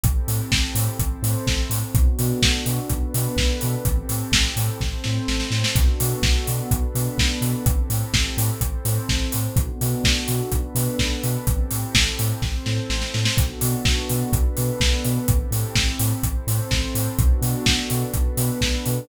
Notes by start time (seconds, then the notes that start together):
0.04 A1 C4 E4 G4 A4, kick, closed hi-hat
0.28 A2, open hi-hat
0.51 A1, kick, snare
0.75 A2, open hi-hat
0.99 A1 C4 E4 A4 C5, kick, closed hi-hat
1.22 A2, open hi-hat
1.47 A1, kick, snare
1.70 A2, open hi-hat
1.95 B1 B3 D4 F#4 A4, kick, closed hi-hat
2.19 B2, open hi-hat
2.42 B1, kick, snare
2.66 B2, open hi-hat
2.90 B1 B3 D4 A4 B4, kick, closed hi-hat
3.14 B2, open hi-hat
3.36 B1, kick, snare
3.61 B2, open hi-hat
3.85 A1 C4 E4 G4 A4, kick, closed hi-hat
4.09 A2, open hi-hat
4.32 A1, kick, snare
4.56 A2, open hi-hat
4.81 A1 C4 E4 A4 C5, kick, snare
5.04 A2, snare
5.28 A1, snare
5.40 snare
5.51 A2, snare
5.64 snare
5.76 B1 B3 D4 F#4 A4, kick, closed hi-hat
6.00 B2, open hi-hat
6.22 B1, kick, snare
6.47 B2, open hi-hat
6.71 B1 B3 D4 A4 B4, kick, closed hi-hat
6.95 B2, open hi-hat
7.18 B1, kick, snare
7.41 B2, open hi-hat
7.66 A1 C4 E4 G4 A4, kick, closed hi-hat
7.90 A2, open hi-hat
8.13 A1, kick, snare
8.37 A2, open hi-hat
8.61 A1 C4 E4 A4 C5, kick, closed hi-hat
8.85 A2, open hi-hat
9.09 A1, kick, snare
9.32 A2, open hi-hat
9.56 B1 B3 D4 F#4 A4, kick, closed hi-hat
9.81 B2, open hi-hat
10.04 B1, kick, snare
10.28 B2, open hi-hat
10.51 B1 B3 D4 A4 B4, kick, closed hi-hat
10.75 B2, open hi-hat
10.99 B1, kick, snare
11.24 B2, open hi-hat
11.47 A1 C4 E4 G4 A4, kick, closed hi-hat
11.71 A2, open hi-hat
11.95 A1, kick, snare
12.19 A2, open hi-hat
12.42 A1 C4 E4 A4 C5, kick, snare
12.66 A2, snare
12.90 A1, snare
13.02 snare
13.14 A2, snare
13.25 snare
13.37 B1 B3 D4 F#4 A4, kick, closed hi-hat
13.61 B2, open hi-hat
13.85 B1, kick, snare
14.09 B2, open hi-hat
14.32 B1 B3 D4 A4 B4, kick, closed hi-hat
14.57 B2, open hi-hat
14.80 B1, kick, snare
15.05 B2, open hi-hat
15.28 A1 C4 E4 G4 A4, kick, closed hi-hat
15.51 A2, open hi-hat
15.76 A1, kick, snare
16.00 A2, open hi-hat
16.23 A1 C4 E4 A4 C5, kick, closed hi-hat
16.47 A2, open hi-hat
16.71 A1, kick, snare
16.95 A2, open hi-hat
17.19 B1 B3 D4 F#4 A4, kick, closed hi-hat
17.42 B2, open hi-hat
17.66 B1, kick, snare
17.90 B2, open hi-hat
18.13 B1 B3 D4 A4 B4, kick, closed hi-hat
18.37 B2, open hi-hat
18.61 B1, kick, snare
18.86 B2, open hi-hat